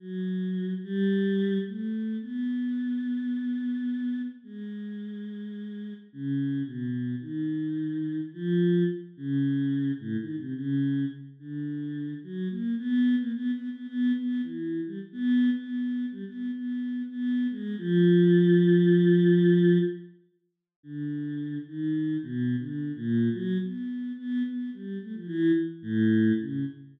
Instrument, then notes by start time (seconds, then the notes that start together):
choir aahs
0.00 F#3
0.83 G3
1.67 A3
2.22 B3
4.44 G#3
6.13 C#3
6.65 B2
7.21 D#3
8.34 F3
9.17 C#3
10.00 A2
10.19 D#3
10.37 C3
10.55 C#3
11.39 D3
12.23 F#3
12.50 A#3
12.78 B3
13.19 A#3
13.34 B3
13.53 B3
13.71 B3
13.87 B3
14.16 B3
14.43 E3
14.86 G3
15.12 B3
15.56 B3
16.12 G3
16.26 B3
16.52 B3
17.09 B3
17.51 G#3
17.78 F3
20.83 D3
21.67 D#3
22.23 B2
22.59 D3
22.96 A#2
23.33 F#3
23.62 B3
24.18 B3
24.45 B3
24.73 G3
25.02 A3
25.14 F3
25.27 E3
25.82 A2
26.40 C#3